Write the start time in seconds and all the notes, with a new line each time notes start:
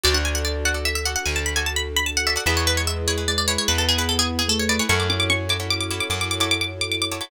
0.04 D2 D4 F#4 A4 D5
0.14 D4 F#5
0.25 G#5
0.35 F#5
0.45 D5
0.65 F#4 A4 D5 F#5
0.74 F#4 A4 D5
0.85 E5
0.95 E5
1.05 F#4 A4 D5 F#5
1.16 F#5
1.25 D2 G#5
1.36 A5
1.46 B5
1.56 F#4 A4 D5 G#5
1.66 A5
1.76 B5
1.96 B5
2.06 A5
2.17 F#5
2.27 F#4 A4 D5 E5
2.36 F#4 A4 D5 F#5
2.46 E2 G#3 E4 G#4 B4 E5
2.57 C#5
2.67 B4
2.77 C#5
2.87 E5
3.07 E4 G#4 B4 C#5
3.18 E4 G#4 B4
3.28 G#3 D5
3.38 D5
3.48 E4 G#4 B4 C#5
3.58 C#5
3.68 E2 B3 B4
3.78 A4
3.88 G#4
3.98 E4 G#4 B4
4.09 A4
4.19 G#4
4.39 G#4
4.48 A3 A4
4.59 C#5
4.69 E4 G#4 B4 D5
4.79 E4 G#4 B4 C#5
4.89 F#2 A3 E4 F#4 A4 C#5 C#6
5.00 D6
5.10 C#4 D6
5.20 D6
5.30 C#4 C#6
5.49 E4 F#4 A4 C#5 D6
5.60 E4 F#4 A4 C#5
5.70 D6
5.80 D6
5.90 E4 F#4 A4 C#5 D6
6.00 D6
6.10 F#2 D6
6.21 D6
6.31 D6
6.40 E4 F#4 A4 C#5 D6
6.51 D6
6.61 D6
6.81 D6
6.91 D6
7.02 D6
7.11 E4 F#4 A4 C#5 D6
7.21 E4 F#4 A4 C#5 D6